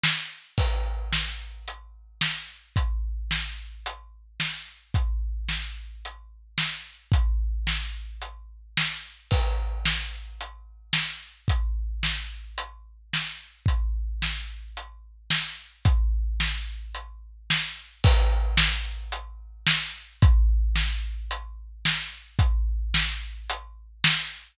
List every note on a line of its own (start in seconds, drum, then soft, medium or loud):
0.04 snare loud
0.58 kick loud
0.58 crash medium
1.13 snare loud
1.68 closed hi-hat loud
2.21 snare loud
2.76 kick loud
2.76 closed hi-hat loud
3.31 snare loud
3.86 closed hi-hat loud
4.40 snare loud
4.94 kick loud
4.94 closed hi-hat loud
5.49 snare medium
6.05 closed hi-hat medium
6.58 snare loud
7.12 kick loud
7.12 closed hi-hat loud
7.67 snare loud
8.22 closed hi-hat loud
8.77 snare loud
9.31 kick loud
9.31 crash loud
9.85 snare loud
10.41 closed hi-hat loud
10.93 snare loud
11.48 kick loud
11.48 closed hi-hat loud
12.03 snare loud
12.58 closed hi-hat loud
13.13 snare loud
13.66 kick loud
13.66 closed hi-hat loud
14.22 snare loud
14.77 closed hi-hat loud
15.30 snare loud
15.85 kick loud
15.85 closed hi-hat loud
16.40 snare loud
16.95 closed hi-hat loud
17.50 snare loud
18.04 kick loud
18.04 crash loud
18.57 snare loud
19.12 closed hi-hat loud
19.67 snare loud
20.22 kick loud
20.22 closed hi-hat loud
20.76 snare loud
21.31 closed hi-hat loud
21.85 snare loud
22.39 kick loud
22.39 closed hi-hat loud
22.94 snare loud
23.50 closed hi-hat loud
24.04 snare loud